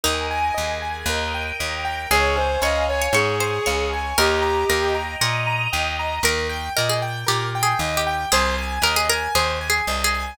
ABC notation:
X:1
M:4/4
L:1/16
Q:1/4=116
K:Ab
V:1 name="Violin"
z16 | A2 c2 e2 d2 A6 z2 | G6 z10 | [K:Eb] z16 |
z16 |]
V:2 name="Harpsichord"
E16 | A4 d3 d d2 c2 d4 | B4 B2 z2 B6 z2 | [K:Eb] B4 B A z2 (3G4 A4 G4 |
A4 B A B2 (3A4 A4 A4 |]
V:3 name="Acoustic Grand Piano"
B2 a2 e2 a2 B2 g2 e2 g2 | d2 a2 f2 a2 d2 a2 f2 a2 | e2 b2 g2 b2 e2 b2 g2 b2 | [K:Eb] B2 g2 e2 g2 B2 g2 e2 g2 |
c2 a2 e2 a2 c2 a2 e2 a2 |]
V:4 name="Electric Bass (finger)" clef=bass
E,,4 E,,4 E,,4 E,,4 | D,,4 D,,4 A,,4 D,,4 | E,,4 E,,4 B,,4 E,,4 | [K:Eb] E,,4 B,,4 B,,4 E,,4 |
C,,4 E,,4 E,,4 C,,4 |]
V:5 name="String Ensemble 1"
[Bea]4 [ABa]4 [Beg]4 [Bgb]4 | [dfa]8 [dad']8 | [egb]8 [ebe']8 | [K:Eb] z16 |
z16 |]